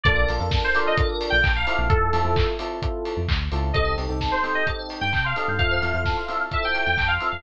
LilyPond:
<<
  \new Staff \with { instrumentName = "Electric Piano 2" } { \time 4/4 \key c \dorian \tempo 4 = 130 d''8 r8. c''8 ees''16 r8. g''8 f''8. | a'4. r2 r8 | ees''8 r8. c''8 ees''16 r8. g''8 f''8. | f''2 e''16 g''8 g''16 g''16 f''8 f''16 | }
  \new Staff \with { instrumentName = "Electric Piano 1" } { \time 4/4 \key c \dorian <d' f' a' bes'>8 <d' f' a' bes'>16 <d' f' a' bes'>8. <d' f' a' bes'>8 <d' f' a' bes'>4. <c' e' f' a'>8~ | <c' e' f' a'>8 <c' e' f' a'>16 <c' e' f' a'>8. <c' e' f' a'>8 <c' e' f' a'>4. <c' e' f' a'>8 | <c' ees' g' a'>8 <c' ees' g' a'>16 <c' ees' g' a'>8. <c' ees' g' a'>8 <c' ees' g' a'>4. <c' ees' g' a'>8 | <c' e' f' a'>8 <c' e' f' a'>16 <c' e' f' a'>8. <c' e' f' a'>8 <c' e' f' a'>4. <c' e' f' a'>8 | }
  \new Staff \with { instrumentName = "Tubular Bells" } { \time 4/4 \key c \dorian a'16 bes'16 d''16 f''16 a''16 bes''16 d'''16 f'''16 a'16 bes'16 d''16 f''16 a''16 bes''16 d'''16 f'''16 | r1 | a'16 c''16 ees''16 g''16 a''16 c'''16 ees'''16 g'''16 a'16 c''16 ees''16 g''16 a''16 c'''16 ees'''16 g'''16 | a'16 c''16 e''16 f''16 a''16 c'''16 e'''16 f'''16 a'16 c''16 e''16 f''16 a''16 c'''16 e'''16 f'''16 | }
  \new Staff \with { instrumentName = "Synth Bass 1" } { \clef bass \time 4/4 \key c \dorian bes,,8 bes,,16 f,2 bes,,16 bes,,8. bes,,16 | f,8 f,16 f,2 f,16 d,8 des,8 | c,8 c,16 c,2 g,16 c8. g,16 | f,8 f,16 f,2 f,16 f,8. f,16 | }
  \new DrumStaff \with { instrumentName = "Drums" } \drummode { \time 4/4 <hh bd>8 hho8 <bd sn>8 hho8 <hh bd>8 hho8 <hc bd>8 hho8 | <hh bd>8 hho8 <hc bd>8 hho8 <hh bd>8 hho8 <hc bd>8 hho8 | <hh bd>8 hho8 <bd sn>8 hho8 <hh bd>8 hho8 <hc bd>8 hho8 | <hh bd>8 hho8 <bd sn>8 hho8 <hh bd>8 hho8 <hc bd>8 hho8 | }
>>